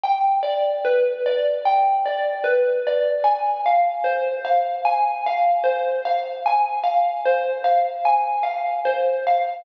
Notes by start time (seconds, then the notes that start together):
0.04 G5
0.43 D5
0.85 B4
1.26 D5
1.65 G5
2.06 D5
2.44 B4
2.87 D5
3.24 G#5
3.66 F5
4.04 C5
4.45 F5
4.85 G#5
5.26 F5
5.64 C5
6.05 F5
6.46 G#5
6.84 F5
7.26 C5
7.64 F5
8.05 G#5
8.43 F5
8.85 C5
9.27 F5